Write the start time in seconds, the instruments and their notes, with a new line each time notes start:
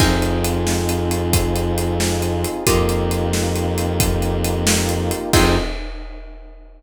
0.00 violin F2, pizzicato strings C4 D#4 F4 G#4, brass section C4 D#4 F4 G#4, kick, crash
0.22 closed hi-hat
0.44 closed hi-hat
0.67 snare
0.89 closed hi-hat
1.11 closed hi-hat
1.33 kick, closed hi-hat
1.56 closed hi-hat
1.78 closed hi-hat
2.00 snare
2.22 closed hi-hat
2.44 closed hi-hat
2.65 violin F2, pizzicato strings A#3 D#4 F4 G4, brass section A#3 D#4 F4 G4, kick, closed hi-hat
2.89 closed hi-hat
3.11 closed hi-hat
3.33 snare
3.56 closed hi-hat
3.78 closed hi-hat
4.00 kick, closed hi-hat
4.22 closed hi-hat
4.44 closed hi-hat
4.67 snare
4.89 closed hi-hat
5.11 closed hi-hat
5.33 violin F2, brass section C4 D#4 F4 G#4, pizzicato strings C4 D#4 F4 G#4, kick, crash